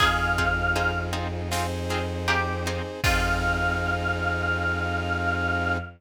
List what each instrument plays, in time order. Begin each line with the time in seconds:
0.00 violin F2, orchestral harp C4 D#4 F4 G#4, brass section C4 D#4 F4 G#4, pizzicato strings G#4, choir aahs F5, kick, crash
0.38 orchestral harp C4 D#4 F4 G#4, kick, ride
0.75 orchestral harp C4 D#4 F4 G#4, ride
1.13 orchestral harp C4 D#4 F4 G#4, ride
1.50 brass section C4 D#4 G#4 C5, orchestral harp C4 D#4 F4 G#4, snare
1.90 orchestral harp C4 D#4 F4 G#4, snare, ride
2.28 orchestral harp C4 D#4 F4 G#4, pizzicato strings G4, ride
2.66 orchestral harp C4 D#4 F4 G#4, ride
3.04 violin F2, brass section C4 D#4 F4 G#4, orchestral harp C4 D#4 F4 G#4, pizzicato strings F4, choir aahs F5, kick, crash